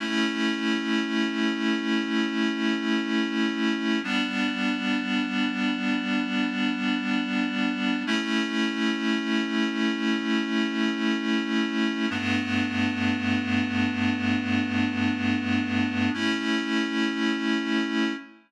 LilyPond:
\new Staff { \time 4/4 \key a \mixolydian \tempo 4 = 119 <a cis' e'>1~ | <a cis' e'>1 | <g b d'>1~ | <g b d'>1 |
<a cis' e'>1~ | <a cis' e'>1 | <g, a b d'>1~ | <g, a b d'>1 |
<a cis' e'>1 | }